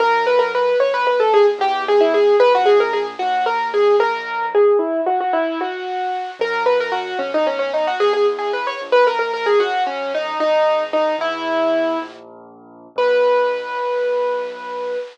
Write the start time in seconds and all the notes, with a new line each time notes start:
0.00 F#2 A#4
0.27 B4
0.39 A#4
0.55 B4
0.80 B1 C#5
0.94 B4
1.07 B4
1.20 A4
1.34 G#4
1.59 E2 G4
1.88 G#4
2.00 E4
2.14 G#4
2.40 A#1 B4
2.55 F#4
2.66 G#4
2.80 A#4
2.93 G#4
3.19 D#2 F#4
3.46 A#4
3.74 G#4
3.99 B1 A#4
4.55 G#4
4.79 E4
5.06 F#4
5.20 F#4
5.33 E4
5.61 F#4
6.39 F#2 A#4
6.66 B4
6.80 A#4
6.92 F#4
7.19 B1 C#4
7.34 D#4
7.47 C#4
7.59 C#4
7.74 D#4
7.87 F#4
8.00 E2 G#4
8.13 G#4
8.39 G#4
8.53 B4
8.67 C#5
8.81 A#1
8.92 B4
9.07 A#4
9.19 A#4
9.33 A#4
9.46 G#4
9.59 F#2 F#4
9.87 C#4
10.15 D#4
10.39 G#1 D#4
10.93 D#4
11.18 E2 E4
12.02 A#1
12.96 B1 B4